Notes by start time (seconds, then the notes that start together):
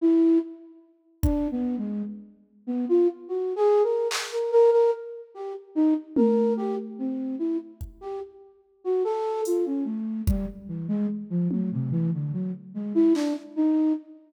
0.01 E4
1.23 D4, kick
1.51 B3
1.78 G#3
2.67 B3
2.89 F4
3.28 F#4
3.56 G#4
3.83 A#4
4.11 clap
4.32 A#4
4.52 A#4
4.72 A#4
5.34 G4
5.75 D#4
6.16 A#4, high tom
6.57 G4
6.98 C4
7.39 E4
7.81 kick
8.01 G4
8.84 F#4
9.04 A4
9.45 F4, closed hi-hat
9.66 C#4
9.85 A3
10.27 G3, kick
10.68 E3
10.88 G#3
11.30 F3
11.51 F#3, high tom
11.72 C3
11.91 E3
12.13 D3
12.33 F#3
12.74 G#3
12.95 E4
13.15 D4, clap
13.56 D#4